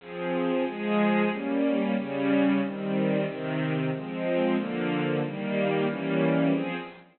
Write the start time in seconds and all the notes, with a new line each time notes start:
0.00 F3 C4 G#4
0.65 F3 G#3 G#4
1.30 G3 A#3 C#4
1.96 C#3 G3 C#4
2.61 D#3 G3 C4
3.26 C3 D#3 C4
3.91 F3 G#3 C4
4.57 D3 F3 A#3
5.22 D#3 G3 A#3
5.88 E3 G3 A#3 C#4
6.52 F3 C4 G#4